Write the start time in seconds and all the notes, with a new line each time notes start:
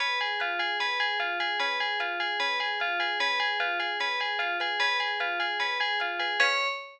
0.00 C#4 B4
0.20 G#4 G#5
0.40 F4 B4
0.59 G#4 F5
0.80 C#4 B4
1.00 G#4 G#5
1.20 F4 F5
1.40 G#4 B4
1.60 C#4 B4
1.80 G#4 G#5
2.00 F4 B4
2.20 G#4 F5
2.40 C#4 B4
2.60 G#4 G#5
2.80 F4 F5
3.00 G#4 B4
3.20 C#4 B4
3.40 G#4 G#5
3.60 F4 B4
3.80 G#4 F5
4.00 C#4 B4
4.20 G#4 G#5
4.39 F4 F5
4.60 G#4 B4
4.80 C#4 B4
5.00 G#4 G#5
5.20 F4 B4
5.40 G#4 F5
5.60 C#4 B4
5.80 G#4 G#5
6.00 F4 F5
6.19 G#4 B4
6.40 C#4 B4 C#5 F5 G#5